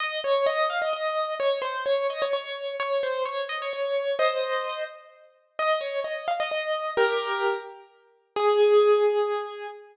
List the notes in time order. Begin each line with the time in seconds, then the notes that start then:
0.00 D#5
0.24 C#5
0.46 D#5
0.69 F5
0.81 D#5
0.93 D#5
1.40 C#5
1.62 C5
1.85 C#5
2.10 D#5
2.22 C#5
2.33 C#5
2.80 C#5
3.03 C5
3.25 C#5
3.49 D#5
3.62 C#5
3.73 C#5
4.19 C5 D#5
5.59 D#5
5.81 C#5
6.04 D#5
6.28 F5
6.40 D#5
6.51 D#5
6.97 G4 A#4
8.36 G#4